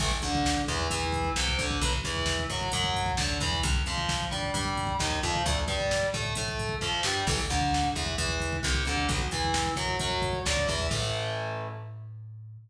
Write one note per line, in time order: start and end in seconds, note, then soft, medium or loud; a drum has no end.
0.00 0.19 A1 loud
0.00 0.10 E3 medium
0.00 0.10 A3 medium
0.00 kick loud
0.00 crash loud
0.11 kick medium
0.22 0.61 D2 medium
0.22 0.61 D3 medium
0.22 kick loud
0.22 closed hi-hat medium
0.35 kick loud
0.45 kick loud
0.45 snare loud
0.57 kick medium
0.68 0.88 E2 loud
0.68 0.87 E3 loud
0.68 kick loud
0.68 closed hi-hat medium
0.80 kick medium
0.90 1.30 E2 loud
0.90 1.29 E3 loud
0.90 kick loud
0.90 closed hi-hat loud
1.02 kick medium
1.12 kick loud
1.12 closed hi-hat medium
1.25 kick medium
1.36 1.55 C2 loud
1.36 1.56 C3 medium
1.36 kick medium
1.36 snare loud
1.48 kick medium
1.59 1.78 D2 loud
1.59 1.79 D3 medium
1.59 kick loud
1.59 closed hi-hat medium
1.71 kick loud
1.81 2.01 B1 loud
1.81 1.91 F#3 medium
1.81 1.91 B3 medium
1.81 kick loud
1.81 closed hi-hat loud
1.93 kick loud
2.04 2.43 E2 loud
2.04 2.43 E3 medium
2.04 kick loud
2.04 closed hi-hat medium
2.16 kick medium
2.26 kick loud
2.26 snare loud
2.39 kick medium
2.50 2.69 F#2 medium
2.50 2.70 F#3 medium
2.50 kick medium
2.50 closed hi-hat medium
2.61 kick loud
2.72 3.11 F#2 loud
2.72 3.12 F#3 loud
2.72 kick loud
2.72 closed hi-hat loud
2.84 kick loud
2.94 kick loud
2.94 closed hi-hat medium
3.06 kick loud
3.17 3.38 D2 medium
3.17 3.37 D3 medium
3.17 kick loud
3.17 snare loud
3.30 kick medium
3.40 3.60 E2 loud
3.40 3.60 E3 loud
3.40 kick loud
3.40 closed hi-hat medium
3.53 kick loud
3.63 3.83 C2 loud
3.63 kick loud
3.63 closed hi-hat loud
3.75 kick loud
3.86 4.25 F2 loud
3.86 4.25 F3 medium
3.86 kick medium
3.86 closed hi-hat medium
3.98 kick loud
4.09 kick loud
4.09 snare loud
4.21 kick medium
4.31 4.52 G2 medium
4.31 4.50 G3 medium
4.31 kick medium
4.31 closed hi-hat medium
4.43 kick medium
4.54 4.93 G2 loud
4.54 4.93 G3 medium
4.54 kick loud
4.54 closed hi-hat loud
4.65 kick medium
4.77 kick loud
4.77 closed hi-hat medium
4.87 kick loud
4.99 5.19 D#2 loud
4.99 5.19 D#3 medium
4.99 kick loud
4.99 snare loud
5.11 kick medium
5.23 5.43 F2 loud
5.23 5.42 F3 loud
5.23 kick loud
5.23 closed hi-hat medium
5.36 kick loud
5.46 5.65 D2 loud
5.46 5.55 A3 medium
5.46 5.55 D4 medium
5.46 kick loud
5.46 closed hi-hat loud
5.58 kick loud
5.68 6.06 G2 loud
5.68 6.07 G3 medium
5.68 kick loud
5.68 closed hi-hat medium
5.80 kick loud
5.91 kick loud
5.91 snare loud
6.03 kick medium
6.14 6.33 A2 loud
6.14 6.33 A3 medium
6.14 kick loud
6.14 closed hi-hat medium
6.25 kick medium
6.35 6.75 A2 medium
6.35 6.75 A3 medium
6.35 kick loud
6.35 closed hi-hat loud
6.48 kick loud
6.59 kick loud
6.59 closed hi-hat medium
6.69 kick loud
6.81 7.01 F2 medium
6.81 7.01 F3 medium
6.81 kick medium
6.81 snare medium
7.03 7.24 G2 loud
7.03 7.24 G3 loud
7.03 snare loud
7.27 7.46 A1 loud
7.27 7.37 E3 medium
7.27 7.37 A3 medium
7.27 kick loud
7.27 crash loud
7.40 kick medium
7.50 7.89 D2 loud
7.50 7.88 D3 loud
7.50 kick loud
7.50 closed hi-hat medium
7.61 kick loud
7.74 kick loud
7.74 snare loud
7.84 kick loud
7.95 8.15 E2 loud
7.95 8.15 E3 loud
7.95 kick medium
7.95 closed hi-hat medium
8.06 kick medium
8.18 8.57 E2 loud
8.18 8.57 E3 medium
8.18 kick loud
8.18 closed hi-hat loud
8.29 kick medium
8.40 kick medium
8.40 closed hi-hat medium
8.53 kick loud
8.63 8.84 C2 loud
8.63 8.82 C3 loud
8.63 kick medium
8.63 snare loud
8.75 kick loud
8.85 9.07 D2 loud
8.85 9.06 D3 medium
8.85 kick medium
8.85 closed hi-hat medium
8.97 kick medium
9.09 9.28 B1 loud
9.09 9.18 F#3 medium
9.09 9.18 B3 loud
9.09 kick loud
9.09 closed hi-hat loud
9.19 kick medium
9.31 9.71 E2 medium
9.31 9.71 E3 medium
9.31 kick medium
9.31 closed hi-hat medium
9.45 kick medium
9.54 kick loud
9.54 snare loud
9.66 kick loud
9.76 9.96 F#2 medium
9.76 9.96 F#3 medium
9.76 kick loud
9.76 closed hi-hat medium
9.88 kick medium
9.99 10.39 F#2 medium
9.99 10.39 F#3 medium
9.99 kick loud
9.99 closed hi-hat loud
10.10 kick medium
10.22 kick loud
10.22 closed hi-hat medium
10.33 kick loud
10.45 10.65 D2 loud
10.45 10.65 D3 medium
10.45 kick loud
10.45 snare loud
10.57 kick loud
10.68 10.88 E2 loud
10.68 10.87 E3 medium
10.68 kick loud
10.68 open hi-hat medium
10.80 kick medium
10.91 12.58 A2 loud
10.91 12.58 E3 loud
10.91 12.58 A3 loud
10.91 kick loud
10.91 crash loud